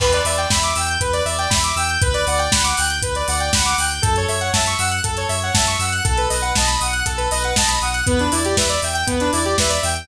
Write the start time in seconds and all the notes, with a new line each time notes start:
0.00 E2 B4, kick, crash
0.13 D5, closed hi-hat
0.25 E2 D5 E5, open hi-hat
0.38 G5, closed hi-hat
0.50 E2 E5 B5, kick, snare
0.63 D6, closed hi-hat
0.76 E2 G5 E6, open hi-hat
0.88 G6, closed hi-hat
1.00 E2 B4, kick, closed hi-hat
1.13 D5, closed hi-hat
1.25 E2 D5 E5, open hi-hat
1.38 G5, closed hi-hat
1.50 E2 E5 B5, kick, snare
1.64 D6, closed hi-hat
1.76 E2 G5 E6, open hi-hat
1.89 G6, closed hi-hat
2.02 D2 B4, kick, closed hi-hat
2.14 D5, closed hi-hat
2.27 D2 D5 F#5, open hi-hat
2.38 G5, closed hi-hat
2.51 D2 F#5 B5, kick, snare
2.64 D6, closed hi-hat
2.77 D2 G5 F#6, open hi-hat
2.90 G6, closed hi-hat
3.01 D2 B4, kick, closed hi-hat
3.15 D5, closed hi-hat
3.27 D2 D5 F#5, open hi-hat
3.40 G5, closed hi-hat
3.53 D2 F#5 B5, kick, snare
3.65 D6, closed hi-hat
3.78 D2 G5 F#6, open hi-hat
3.91 G6, closed hi-hat
4.02 F#2 A4, kick, closed hi-hat
4.16 C#5, closed hi-hat
4.28 F#2 C#5 E5, open hi-hat
4.41 F#5, closed hi-hat
4.53 F#2 E5 A5, kick, snare
4.66 C#6, closed hi-hat
4.78 F#2 F#5 E6, open hi-hat
4.91 F#6, closed hi-hat
5.04 F#2 A4, kick, closed hi-hat
5.17 C#5, closed hi-hat
5.29 F#2 C#5 E5, open hi-hat
5.42 F#5, closed hi-hat
5.54 F#2 E5 A5, kick, snare
5.67 C#6, closed hi-hat
5.79 F#2 F#5 E6, open hi-hat
5.92 F#6, closed hi-hat
6.04 B1 A4, kick, closed hi-hat
6.18 B4, closed hi-hat
6.30 B1 B4 D#5, open hi-hat
6.42 F#5, closed hi-hat
6.55 B1 D#5 A5, kick, snare
6.67 B5, closed hi-hat
6.81 B1 F#5 D#6, open hi-hat
6.93 F#6, closed hi-hat
7.05 B1 A4, kick, closed hi-hat
7.17 B4, closed hi-hat
7.31 B1 B4 D#5, open hi-hat
7.44 F#5, closed hi-hat
7.56 B1 D#5 A5, kick, snare
7.68 B5, closed hi-hat
7.81 B1 F#5 D#6, open hi-hat
7.94 F#6, closed hi-hat
8.06 E2 B3 B4, kick, closed hi-hat
8.19 D4, closed hi-hat
8.32 E2 E4 D5, open hi-hat
8.45 G4, closed hi-hat
8.57 E2 B4 E5, kick, snare
8.69 D5, closed hi-hat
8.82 E2 E5 G5, open hi-hat
8.94 G5, closed hi-hat
9.07 E2 B3 B4, kick, closed hi-hat
9.20 D4, closed hi-hat
9.32 E2 E4 D5, open hi-hat
9.45 G4, closed hi-hat
9.58 E2 B4 E5, kick, snare
9.69 D5, closed hi-hat
9.82 E2 E5 G5, open hi-hat
9.95 G5, closed hi-hat